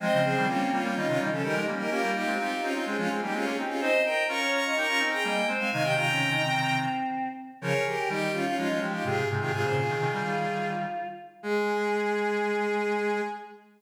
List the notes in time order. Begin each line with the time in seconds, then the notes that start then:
0.00 F3 G#3 C4 C5 D#5
0.12 C#3 F3
0.24 G#4 C5
0.36 D#3 G3
0.47 G3 A#3 C#4 F4
0.72 G3 A#3 C#4 F4
0.82 G3 A#3 C#4 F4
0.95 D#3 G3 C#4 D#4 F4
1.07 C3 D#3 C#4 F4
1.19 D#3 G3 D#4
1.31 C#3 F3 C#4 A4
1.42 D#3 G3 D#4 G4 A#4
1.55 F3 G#3 D#4
1.66 G3 A#3 C#4
1.79 D#4 G4 A#4
1.90 A#3 C#4 F4 G4 A#4
2.03 G3 A#3
2.14 D#4 G4
2.26 G#3 C4
2.39 C4 D#4 G4
2.62 C4 C#4 D#4 F4
2.74 C4 C#4 D#4 F4
2.85 G#3 C4 C#4 F4 G#4
2.97 F3 G#3 C#4 F4
3.09 G#3 C4 G#4
3.21 G3 A#3 D#4 G4
3.33 G#3 C4 C#4 F4 G#4
3.45 A#3 C#4 G#4
3.57 C4 D#4 G4
3.69 C#4 F4 G#4
3.80 C4 D#4 C5 D#5
4.05 A#4 D#5 G5
4.28 C#4 F4 A#4 A#5 C#6
4.40 C#5
4.53 A#5 C#6
4.64 D#5 A#5 C#6
4.76 D#4 G4 A#4 A#5 C#6
4.87 C#4 F4 A#5 C#6
4.99 C4 D#4
5.11 G#4 G5 A#5
5.24 G3 A#3 D#5 G5
5.47 G#3 C4 C5
5.58 G#3 C4 F5 G#5
5.71 C3 D#3 D#4 F5 G#5
5.82 G4 D#5 G5
5.95 F4 G5 A#5
6.07 C#4
6.31 D#4
6.43 C4
7.61 C#3 F3 G#4 A#4 C#5
7.86 G4 A#4
7.98 G4
8.09 D#3 G3 D#4 G4
8.33 C#4 F4
8.45 C#4 F4
8.57 F3 G#3 C#4 D#4 F4
8.68 F3 G#3 C#4 F4
8.81 F3 G#3 G4
8.93 D#4 F4 G4
9.04 G#2 C3 F4 G4 G#4
9.17 G#4
9.29 G#2 C3 G#4
9.40 C3 D#3 F4 G4 G#4
9.52 G#2 C3 F4 G#4
9.63 A#2 C#3 G#4 C5
9.76 F4 G#4
9.88 C3 D#3
10.00 C3 D#3
10.12 D#3 G3
10.24 D#3 G3 F4
11.43 G#3 G#4